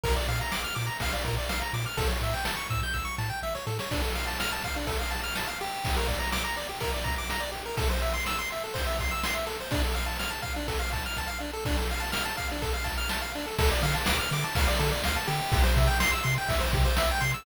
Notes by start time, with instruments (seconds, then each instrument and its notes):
0.04 synth bass 1 A#1, lead 1 (square) A#4, kick, ride
0.16 lead 1 (square) D5
0.28 synth bass 1 A#2, lead 1 (square) F5, ride
0.41 lead 1 (square) A#5
0.52 synth bass 1 A#1, lead 1 (square) D6, snare
0.64 lead 1 (square) F6
0.75 synth bass 1 A#2, lead 1 (square) D6, ride
0.87 lead 1 (square) A#5
1.00 synth bass 1 A#1, lead 1 (square) F5, kick, ride
1.13 lead 1 (square) D5
1.25 synth bass 1 A#2, lead 1 (square) A#4, kick, ride
1.38 lead 1 (square) D5
1.49 synth bass 1 A#1, lead 1 (square) F5, snare
1.62 lead 1 (square) A#5
1.73 synth bass 1 A#2, lead 1 (square) D6, ride
1.86 lead 1 (square) F6
1.97 synth bass 1 A1, lead 1 (square) A4, kick, ride
2.08 lead 1 (square) C#5
2.21 synth bass 1 A2, lead 1 (square) E5, ride
2.34 lead 1 (square) G5
2.45 synth bass 1 A1, lead 1 (square) A5, snare
2.57 lead 1 (square) C#6
2.70 synth bass 1 A2, lead 1 (square) E6, kick, ride
2.83 lead 1 (square) G6
2.94 synth bass 1 A1, lead 1 (square) E6, kick, snare
3.05 lead 1 (square) C#6
3.18 synth bass 1 A2, lead 1 (square) A5, snare
3.30 lead 1 (square) G5
3.42 synth bass 1 A1, lead 1 (square) E5, snare
3.55 lead 1 (square) C#5, snare
3.67 synth bass 1 A2, lead 1 (square) A4, snare
3.79 lead 1 (square) C#5, snare
3.91 lead 1 (square) D4, kick, crash
4.02 lead 1 (square) A4
4.15 lead 1 (square) F5, ride
4.27 lead 1 (square) A5
4.40 lead 1 (square) F6, snare
4.52 lead 1 (square) A5
4.64 lead 1 (square) F5, kick, ride
4.76 lead 1 (square) D4
4.87 lead 1 (square) A4, kick, ride
4.99 lead 1 (square) F5
5.10 lead 1 (square) A5, ride
5.24 lead 1 (square) F6
5.35 lead 1 (square) A5, snare
5.47 lead 1 (square) F5
5.60 lead 1 (square) G4, ride
5.85 kick, ride
5.96 lead 1 (square) A#4
6.08 lead 1 (square) D5, kick, ride
6.19 lead 1 (square) A#5
6.32 lead 1 (square) D6, snare
6.45 lead 1 (square) A#5
6.56 lead 1 (square) D5, ride
6.69 lead 1 (square) G4
6.80 lead 1 (square) A#4, kick, ride
6.94 lead 1 (square) D5
7.04 lead 1 (square) A#5, kick, ride
7.18 lead 1 (square) D6
7.30 lead 1 (square) A#5, snare
7.40 lead 1 (square) D5
7.52 lead 1 (square) G4, ride
7.66 lead 1 (square) A#4
7.77 lead 1 (square) A4, kick, ride
7.90 lead 1 (square) C5
8.02 lead 1 (square) E5, ride
8.14 lead 1 (square) C6
8.26 lead 1 (square) E6, snare
8.39 lead 1 (square) C6
8.50 lead 1 (square) E5, ride
8.64 lead 1 (square) A4
8.74 lead 1 (square) C5, kick, ride
8.87 lead 1 (square) E5
8.99 lead 1 (square) C6, kick, ride
9.11 lead 1 (square) E6
9.23 lead 1 (square) C6, snare
9.34 lead 1 (square) E5
9.46 lead 1 (square) A4, ride
9.60 lead 1 (square) C5
9.71 lead 1 (square) D4, kick, ride
9.84 lead 1 (square) A4
9.95 lead 1 (square) F5, ride
10.06 lead 1 (square) A5
10.19 lead 1 (square) F6, snare
10.30 lead 1 (square) A5
10.42 lead 1 (square) F5, kick, ride
10.56 lead 1 (square) D4
10.68 lead 1 (square) A4, kick, ride
10.79 lead 1 (square) F5
10.93 lead 1 (square) A5, kick, ride
11.06 lead 1 (square) F6
11.17 lead 1 (square) A5, kick, snare
11.28 lead 1 (square) F5
11.40 lead 1 (square) D4
11.53 lead 1 (square) A4
11.65 lead 1 (square) D4, kick, crash
11.77 lead 1 (square) A4
11.89 lead 1 (square) F5, ride
12.00 lead 1 (square) A5
12.12 lead 1 (square) F6, snare
12.25 lead 1 (square) A5
12.37 lead 1 (square) F5, kick, ride
12.52 lead 1 (square) D4
12.62 lead 1 (square) A4, kick, ride
12.74 lead 1 (square) F5
12.84 lead 1 (square) A5, kick, ride
12.98 lead 1 (square) F6
13.09 lead 1 (square) A5, snare
13.21 lead 1 (square) F5
13.35 lead 1 (square) D4, ride
13.46 lead 1 (square) A4
13.58 synth bass 1 D2, lead 1 (square) A4, kick, ride
13.72 lead 1 (square) D5
13.83 synth bass 1 D3, lead 1 (square) F5, ride
13.95 lead 1 (square) A5
14.06 synth bass 1 D2, lead 1 (square) D6, snare
14.19 lead 1 (square) F6
14.31 synth bass 1 D3, lead 1 (square) D6, ride
14.44 lead 1 (square) A5
14.55 synth bass 1 D2, lead 1 (square) F5, kick, ride
14.68 lead 1 (square) D5
14.79 synth bass 1 D3, lead 1 (square) A4, ride
14.92 lead 1 (square) D5
15.04 synth bass 1 D2, lead 1 (square) F5, snare
15.16 lead 1 (square) A5
15.27 synth bass 1 D3, lead 1 (square) G4, ride
15.52 synth bass 1 C2, kick, ride
15.63 lead 1 (square) C5
15.76 synth bass 1 C3, lead 1 (square) E5, kick, ride
15.87 lead 1 (square) G5
16.00 synth bass 1 C2, lead 1 (square) C6, snare
16.12 lead 1 (square) E6
16.23 synth bass 1 C3, lead 1 (square) C6, ride
16.38 lead 1 (square) G5
16.48 synth bass 1 C2, lead 1 (square) E5, kick, ride
16.60 lead 1 (square) C5
16.73 synth bass 1 C3, lead 1 (square) G4, kick, ride
16.85 lead 1 (square) C5
16.97 synth bass 1 C2, lead 1 (square) E5, snare
17.11 lead 1 (square) G5
17.21 synth bass 1 C3, lead 1 (square) C6, ride
17.34 lead 1 (square) E6